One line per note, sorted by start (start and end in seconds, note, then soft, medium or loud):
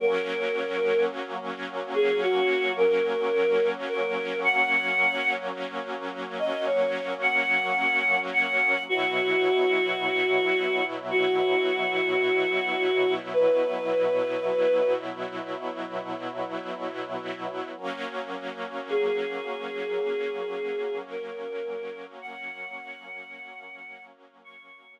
0.00 8.79 F#3 loud
0.00 8.79 A#3 medium
0.00 8.79 C#4 loud
0.00 1.05 A#4 medium
1.94 2.21 G#4 medium
2.22 2.72 F#4 medium
2.77 3.69 A#4 medium
3.89 4.40 A#4 medium
4.44 5.33 F#5 medium
6.39 6.66 D#5 medium
6.67 7.14 C#5 medium
7.22 8.19 F#5 medium
8.33 8.84 F#5 medium
8.89 17.69 B2 medium
8.89 17.69 F#3 medium
8.89 17.69 E4 medium
8.89 10.84 F#4 medium
11.11 13.14 F#4 medium
13.33 14.93 B4 medium
17.77 25.00 F#3 medium
17.77 25.00 A#3 medium
17.77 25.00 C#4 medium
18.89 20.99 G#4 medium
21.10 22.06 A#4 medium
22.22 24.06 F#5 medium
24.44 24.94 C#6 medium